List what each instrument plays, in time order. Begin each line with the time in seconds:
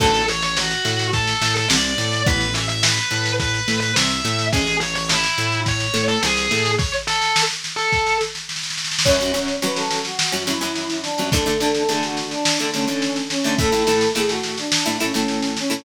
0.00 synth bass 1 A1, acoustic guitar (steel) D3 F#3 A3, distortion guitar A4, kick, snare, crash
0.14 snare
0.28 distortion guitar C#5, snare
0.42 distortion guitar C#5, snare
0.57 distortion guitar F#4, snare
0.71 snare
0.85 synth bass 1 A2, acoustic guitar (steel) A3, snare
0.99 snare
1.13 distortion guitar A4, kick, snare
1.27 snare
1.41 synth bass 1 A2, acoustic guitar (steel) A3, snare
1.56 distortion guitar A4, snare
1.68 synth bass 1 C2, acoustic guitar (steel) C3, distortion guitar D5, snare
1.84 snare
1.98 synth bass 1 A2, acoustic guitar (steel) A3, snare
2.12 snare
2.26 synth bass 1 A1, acoustic guitar (steel) E3 B3, distortion guitar B4, kick, snare
2.41 snare
2.54 distortion guitar E5, snare
2.69 distortion guitar E5, snare
2.83 distortion guitar B4, snare
2.97 snare
3.11 synth bass 1 A2, acoustic guitar (steel) A3, snare
3.25 snare
3.40 distortion guitar B4, kick, snare
3.54 snare
3.68 synth bass 1 A2, acoustic guitar (steel) A3, snare
3.80 distortion guitar B4, snare
3.96 synth bass 1 C2, acoustic guitar (steel) C3, distortion guitar E5, snare
4.10 snare
4.25 synth bass 1 A2, acoustic guitar (steel) A3, snare
4.39 snare
4.52 synth bass 1 A1, acoustic guitar (steel) G#3 C#4, distortion guitar G#4, kick, snare
4.67 snare
4.80 distortion guitar C#5, snare
4.95 distortion guitar C#5, snare
5.09 distortion guitar E4, snare
5.24 snare
5.38 synth bass 1 A2, acoustic guitar (steel) A3, snare
5.52 snare
5.66 distortion guitar C#5, kick, snare
5.80 snare
5.94 synth bass 1 A2, acoustic guitar (steel) A3, snare
6.08 distortion guitar A4, snare
6.23 synth bass 1 C2, acoustic guitar (steel) C3, distortion guitar G#4, snare
6.37 snare
6.51 synth bass 1 A2, acoustic guitar (steel) A3, snare
6.65 snare
6.78 distortion guitar C#5, kick, snare
6.93 snare
7.07 distortion guitar A4, snare
7.22 snare
7.36 snare
7.50 snare
7.64 snare
7.76 distortion guitar A4, snare
7.92 kick, snare
8.07 snare
8.21 snare
8.35 snare
8.49 snare
8.56 snare
8.63 snare
8.70 snare
8.77 snare
8.84 snare
8.92 snare
8.99 snare
9.05 acoustic guitar (steel) F#2 F#3 C#4, brass section C#5, kick, snare, crash
9.20 acoustic guitar (steel) F#2 F#3 C#4, snare
9.34 acoustic guitar (steel) F#2 F#3 C#4, snare
9.48 snare
9.62 acoustic guitar (steel) F#2 F#3 C#4, brass section B4, snare
9.75 brass section A4, snare
9.91 snare
10.05 brass section F#4, snare
10.19 snare
10.32 acoustic guitar (steel) F#2 F#3 C#4, snare
10.47 acoustic guitar (steel) F#2 F#3 C#4, brass section E4, snare
10.61 acoustic guitar (steel) F#2 F#3 C#4, snare
10.75 snare
10.90 snare
11.02 brass section D4, snare
11.18 acoustic guitar (steel) F#2 F#3 C#4, snare
11.32 acoustic guitar (steel) D3 A3 D4, brass section A4, kick, snare
11.46 acoustic guitar (steel) D3 A3 D4, snare
11.60 acoustic guitar (steel) D3 A3 D4, snare
11.75 snare
11.88 acoustic guitar (steel) D3 A3 D4, brass section G#4, snare
12.03 brass section F#4, snare
12.17 snare
12.30 brass section D4, snare
12.45 snare
12.59 acoustic guitar (steel) D3 A3 D4, snare
12.72 acoustic guitar (steel) D3 A3 D4, brass section C#4, snare
12.88 acoustic guitar (steel) D3 A3 D4, snare
13.02 snare
13.16 snare
13.30 brass section C#4, snare
13.44 acoustic guitar (steel) D3 A3 D4, snare
13.58 acoustic guitar (steel) A2 A3 E4, brass section A4, kick, snare
13.72 acoustic guitar (steel) A2 A3 E4, snare
13.87 acoustic guitar (steel) A2 A3 E4, snare
14.01 snare
14.15 acoustic guitar (steel) A2 A3 E4, brass section G#4, snare
14.29 brass section F#4, snare
14.43 snare
14.58 brass section D4, snare
14.72 snare
14.86 acoustic guitar (steel) A2 A3 E4, snare
15.00 acoustic guitar (steel) A2 A3 E4, brass section C#4, snare
15.14 acoustic guitar (steel) A2 A3 E4, snare
15.28 snare
15.42 snare
15.57 brass section C#4, snare
15.70 acoustic guitar (steel) A2 A3 E4, snare